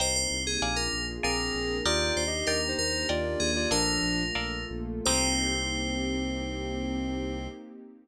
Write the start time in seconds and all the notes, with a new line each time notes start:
0.00 C2 A#3 C4 D#4 G4 A#4 C5 D#5 G5
0.16 C5
0.31 C2
0.47 G#4
0.62 A#1 A#3 D4 F4 G#4 A#4 D5 F5 G#5
0.76 A#4
0.93 A#1
1.23 A#1 A#3 C4 D4 G#4 A#4 D5 F5 G#5
1.55 A#1
1.85 D#2 A#3 D4 D#4 F4 G4 A#4 D5 D#5 G5
2.16 D#2 C5
2.27 G4 D#5
2.47 D#2 A#4 D5 D#5 G5
2.68 D#4 C5
2.78 D#2 A#3 D4 G4 A#4
3.09 D#2 F4 A#4 D5 D#5 G5
3.40 D#2 G#4
3.56 F4 D5
3.71 A#1 F3 A3 A#3 D4 F4 A4 A#4 D5 F5
4.03 A#1
4.35 A#1 A3 A#3 F4 A4 A#4 D5 F5
4.70 A#1
5.05 C2 A#3 C4 D#4 G4 C5